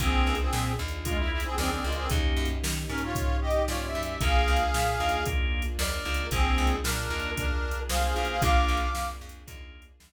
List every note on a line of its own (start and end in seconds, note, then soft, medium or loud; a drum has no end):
0.00 0.22 A#1 loud
0.00 0.37 A#3 loud
0.00 2.08 A#3 medium
0.00 0.35 C4 medium
0.00 0.37 D4 loud
0.00 2.08 D4 loud
0.00 0.37 F4 loud
0.00 2.08 F4 medium
0.00 0.35 G#4 loud
0.00 0.37 G#4 loud
0.00 2.08 G#4 medium
0.00 kick loud
0.00 closed hi-hat loud
0.27 0.49 C#2 medium
0.35 closed hi-hat medium
0.40 0.73 C4 medium
0.40 0.73 G#4 medium
0.53 0.75 A#2 medium
0.53 snare loud
0.79 1.46 D#2 loud
0.88 closed hi-hat medium
1.05 1.17 G#3 medium
1.05 1.42 A#3 medium
1.05 1.42 D4 medium
1.05 1.17 F4 medium
1.05 1.42 F4 medium
1.05 1.42 G#4 medium
1.05 kick loud
1.05 closed hi-hat loud
1.18 1.31 E4 medium
1.32 1.45 E4 loud
1.40 1.56 C4 medium
1.40 1.56 G#4 loud
1.40 closed hi-hat loud
1.58 1.80 D#2 medium
1.58 1.71 C4 medium
1.58 1.71 G#4 loud
1.58 2.04 A#4 medium
1.58 2.04 D5 medium
1.58 snare loud
1.72 1.84 C4 medium
1.72 1.84 G#4 medium
1.84 2.07 C#2 medium
1.84 1.96 G#3 medium
1.84 1.96 F4 medium
1.92 closed hi-hat medium
1.96 2.09 C4 medium
1.96 2.09 G#4 medium
2.10 2.33 D#2 loud
2.10 4.19 A#3 medium
2.10 2.47 A#3 loud
2.10 4.19 C#4 loud
2.10 2.47 C#4 medium
2.10 4.19 D#4 medium
2.10 2.47 D#4 loud
2.10 4.19 G4 medium
2.10 2.47 G4 loud
2.10 kick loud
2.10 closed hi-hat loud
2.37 2.59 F#2 medium
2.45 closed hi-hat medium
2.63 2.86 D#3 medium
2.63 snare loud
2.89 3.57 G#2 medium
2.89 3.01 C#4 medium
2.89 3.01 A#4 loud
2.98 closed hi-hat medium
3.04 3.37 F4 medium
3.04 3.37 C#5 loud
3.15 kick loud
3.15 closed hi-hat loud
3.42 3.63 G4 medium
3.42 3.63 D#5 loud
3.51 closed hi-hat medium
3.68 3.91 G#2 medium
3.68 3.85 F4 medium
3.68 3.85 C#5 medium
3.68 4.15 D5 medium
3.68 snare loud
3.86 4.03 E5 medium
3.95 4.17 F#2 medium
4.03 4.20 E5 medium
4.03 closed hi-hat loud
4.21 4.43 A#1 loud
4.21 4.58 A#3 loud
4.21 6.30 A#3 loud
4.21 4.58 D4 loud
4.21 6.30 D4 medium
4.21 4.58 F4 loud
4.21 6.30 F4 medium
4.21 4.58 G#4 loud
4.21 6.30 G#4 medium
4.21 5.24 G#4 loud
4.21 5.24 F5 loud
4.21 kick loud
4.21 closed hi-hat loud
4.48 4.70 C#2 medium
4.56 closed hi-hat medium
4.74 4.96 A#2 medium
4.74 snare loud
5.00 5.67 D#2 medium
5.00 5.18 A#3 medium
5.00 5.18 D4 medium
5.00 5.18 F4 medium
5.00 5.18 G#4 medium
5.09 closed hi-hat medium
5.26 5.63 A#3 loud
5.26 5.63 D4 loud
5.26 5.63 F4 medium
5.26 5.63 G#4 medium
5.26 kick loud
5.26 closed hi-hat loud
5.62 closed hi-hat medium
5.79 6.01 D#2 medium
5.79 6.26 A#4 medium
5.79 6.26 D5 loud
5.79 snare loud
6.05 6.28 C#2 medium
6.05 6.24 A#3 medium
6.05 6.24 D4 medium
6.05 6.24 F4 medium
6.05 6.24 G#4 medium
6.14 closed hi-hat loud
6.31 6.54 A#1 loud
6.31 6.68 A#3 loud
6.31 8.41 A#3 medium
6.31 6.76 C4 medium
6.31 6.68 D4 loud
6.31 8.41 D4 medium
6.31 6.68 F4 loud
6.31 8.41 F4 medium
6.31 6.76 G#4 loud
6.31 6.68 G#4 loud
6.31 8.41 G#4 medium
6.31 kick loud
6.31 closed hi-hat loud
6.58 6.80 C#2 loud
6.67 closed hi-hat medium
6.83 7.07 A#2 medium
6.83 7.30 D4 medium
6.83 7.30 A#4 loud
6.83 snare loud
7.10 7.77 D#2 medium
7.10 7.47 A#3 medium
7.10 7.47 D4 medium
7.10 7.47 F4 medium
7.10 7.47 G#4 medium
7.20 closed hi-hat medium
7.36 7.80 D4 medium
7.36 7.80 A#4 medium
7.36 kick loud
7.36 closed hi-hat loud
7.71 closed hi-hat medium
7.89 8.13 C2 medium
7.89 8.14 G#4 medium
7.89 8.41 G#4 medium
7.89 8.41 C5 medium
7.89 8.14 F5 loud
7.89 snare loud
8.15 8.40 B1 medium
8.15 8.34 A#3 medium
8.15 8.34 D4 medium
8.15 8.34 F4 medium
8.15 8.28 G#4 medium
8.15 8.34 G#4 medium
8.15 8.28 F5 medium
8.25 closed hi-hat medium
8.30 8.42 G#4 loud
8.30 8.42 F5 loud
8.42 8.65 A#1 loud
8.42 8.79 A#3 loud
8.42 10.12 A#3 medium
8.42 8.88 D4 loud
8.42 8.79 D4 loud
8.42 10.12 D4 medium
8.42 8.88 F4 loud
8.42 8.79 F4 loud
8.42 10.12 F4 medium
8.42 8.79 G#4 loud
8.42 10.12 G#4 medium
8.42 9.09 F5 loud
8.42 9.09 D6 loud
8.42 kick loud
8.42 closed hi-hat loud
8.68 8.91 A#1 loud
8.77 closed hi-hat medium
8.95 9.17 F2 medium
8.95 snare loud
9.21 9.44 F2 medium
9.29 closed hi-hat loud
9.47 9.92 D#2 medium
9.47 9.84 A#3 medium
9.47 9.84 D4 medium
9.47 9.84 F4 medium
9.47 9.84 G#4 medium
9.47 kick loud
9.47 closed hi-hat loud
9.82 closed hi-hat medium
10.00 10.12 D#2 medium
10.00 snare loud